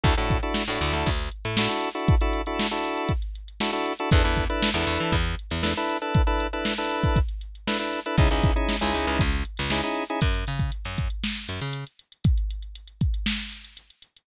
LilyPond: <<
  \new Staff \with { instrumentName = "Drawbar Organ" } { \time 4/4 \key a \major \tempo 4 = 118 <d' e' fis' a'>16 <d' e' fis' a'>8 <d' e' fis' a'>8 <d' e' fis' a'>4.~ <d' e' fis' a'>16 <d' e' fis' a'>16 <d' e' fis' a'>8 <d' e' fis' a'>16~ | <d' e' fis' a'>16 <d' e' fis' a'>8 <d' e' fis' a'>8 <d' e' fis' a'>4.~ <d' e' fis' a'>16 <d' e' fis' a'>16 <d' e' fis' a'>8 <d' e' fis' a'>16 | <d' e' a' b'>16 <d' e' a' b'>8 <d' e' a' b'>8 <d' e' a' b'>4.~ <d' e' a' b'>16 <d' e' a' b'>16 <d' e' a' b'>8 <d' e' a' b'>16~ | <d' e' a' b'>16 <d' e' a' b'>8 <d' e' a' b'>8 <d' e' a' b'>4.~ <d' e' a' b'>16 <d' e' a' b'>16 <d' e' a' b'>8 <d' e' a' b'>16 |
<cis' dis' e' gis'>16 <cis' dis' e' gis'>8 <cis' dis' e' gis'>8 <cis' dis' e' gis'>4.~ <cis' dis' e' gis'>16 <cis' dis' e' gis'>16 <cis' dis' e' gis'>8 <cis' dis' e' gis'>16 | r1 | r1 | }
  \new Staff \with { instrumentName = "Electric Bass (finger)" } { \clef bass \time 4/4 \key a \major d,16 a,4 a,16 d,16 d,16 d,8. a,4~ a,16~ | a,1 | e,16 e,4 e,16 e,16 e16 e,8. e,4~ e,16~ | e,1 |
cis,16 cis,4 cis,16 cis,16 cis,16 cis,8. cis,4~ cis,16 | fis,8 cis8. fis,4~ fis,16 fis,16 cis4~ cis16~ | cis1 | }
  \new DrumStaff \with { instrumentName = "Drums" } \drummode { \time 4/4 <cymc bd>16 hh16 <hh bd>16 hh16 sn16 hh16 hh16 hh16 <hh bd>16 hh16 hh16 hh16 sn16 hh16 hh16 hho16 | <hh bd>16 hh16 hh16 hh16 sn16 hh16 hh16 hh16 <hh bd>16 hh16 hh16 hh16 sn16 hh16 hh16 hh16 | <hh bd>16 hh16 <hh bd>16 hh16 sn16 hh16 hh16 hh16 <hh bd>16 hh16 hh16 hh16 sn16 hh16 hh16 hh16 | <hh bd>16 hh16 hh16 hh16 sn16 hh16 hh16 <hh bd>16 <hh bd>16 hh16 hh16 hh16 sn16 hh16 hh16 hh16 |
<hh bd>16 hh16 <hh bd>16 hh16 sn16 hh16 hh16 hh16 <hh bd>16 hh16 hh16 hh16 sn16 hh16 hh16 hh16 | <hh bd>16 hh16 hh16 <hh bd>16 hh16 hh16 <hh bd>16 hh16 sn16 hh16 hh16 hh16 hh16 hh16 hh16 hh16 | <hh bd>16 hh16 hh16 hh16 hh16 hh16 <hh bd>16 hh16 sn16 hh16 hh16 hh16 hh16 hh16 hh16 hh16 | }
>>